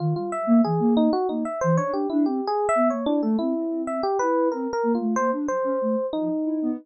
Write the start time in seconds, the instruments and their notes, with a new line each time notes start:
0.00 ocarina D#3, electric piano 1 F4
0.16 ocarina G3, electric piano 1 F4
0.32 electric piano 1 E5
0.47 ocarina A#3
0.65 ocarina E3, electric piano 1 G#4
0.80 ocarina A#3
0.97 electric piano 1 D#4
1.13 electric piano 1 F#4
1.29 ocarina A#3, electric piano 1 D#4
1.45 electric piano 1 E5
1.61 ocarina E3, electric piano 1 C5
1.77 ocarina D4, electric piano 1 C#5
1.92 ocarina D4, electric piano 1 G4
2.10 ocarina D4, electric piano 1 E4
2.26 ocarina C4, electric piano 1 G4
2.47 electric piano 1 G#4
2.69 electric piano 1 E5
2.75 ocarina B3
2.90 ocarina A#3, electric piano 1 C#5
3.06 electric piano 1 D4, ocarina E4
3.22 ocarina A3, electric piano 1 A4
3.39 ocarina C4, electric piano 1 E4
3.57 ocarina C4
3.87 electric piano 1 E5
4.03 electric piano 1 G4
4.19 ocarina E4, electric piano 1 B4
4.52 ocarina C4, electric piano 1 A#4
4.73 electric piano 1 A#4
4.83 ocarina A#3
4.95 electric piano 1 F4
5.01 ocarina A3
5.16 ocarina A#3, electric piano 1 C5
5.32 ocarina D4
5.48 ocarina F#3, electric piano 1 C5
5.64 ocarina C#4
5.82 ocarina A3
6.13 ocarina F3, electric piano 1 D#4
6.45 ocarina E4
6.62 ocarina B3